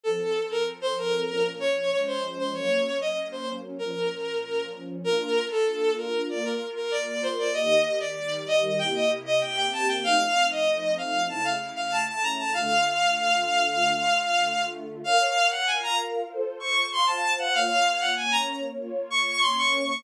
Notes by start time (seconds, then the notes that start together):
0.04 F3 C4 A4
0.51 A#4
0.81 C5
0.97 A#4
1.29 A#2 F3 C#4
1.60 C#5
1.91 F3 G#3 C#4 C#5
2.06 C5
2.38 C5
2.53 F#3 A#3 C#4 C#5
3.01 D#5
3.32 C5
3.79 A#2 F3 C#4 A#4
5.04 A#3 D4 F4 A#4
5.50 A4
5.97 A#4
6.28 A#3 F4 A#4 D5
6.45 A#4
6.76 A#4
6.91 D5
7.07 D5
7.23 C5
7.39 D5
7.54 D#3 A#3 G4 D#5
8.00 D5
8.17 D#3 G3 G4
8.47 D#5
8.79 C3 A#3 E4 G4 G5
8.94 D#5
9.26 D#5
9.41 C3 A#3 C4 G4 G5
9.57 G5
9.72 A5
9.88 G5
10.03 F3 A3 C4 D#4 F5
10.51 D#5
10.98 F5
11.29 C#3 A3 E4 A5
11.44 F5
11.76 F5
11.92 A5
12.07 A5
12.23 A#5
12.38 A5
12.54 D3 A3 F4 F5
15.04 A#4 C#5 F5
15.51 F#5
15.67 F4 A#4 F5 G#5
15.82 A#5
16.29 F4 A4 C5
16.60 C#6
16.91 F4 C5 F5 C6
17.07 A5
17.38 F#5
17.54 A#3 F4 C#5 F5
18.00 F#5
18.16 A#3 C#4 C#5 G#5
18.32 A#5
18.78 A#3 F4 C#5
19.10 C#6
19.41 A#3 C#4 C#5 C6
19.57 C#6
19.88 C#6